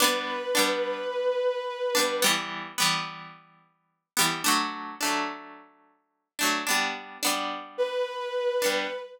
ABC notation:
X:1
M:4/4
L:1/8
Q:1/4=108
K:G
V:1 name="Violin"
B8 | z8 | z8 | z4 B4 |]
V:2 name="Pizzicato Strings"
[G,B,D]2 [G,B,D]5 [G,B,D] | [E,G,B,]2 [E,G,B,]5 [E,G,B,] | [F,A,D]2 [F,A,D]5 [F,A,D] | [G,B,D]2 [G,B,D]5 [G,B,D] |]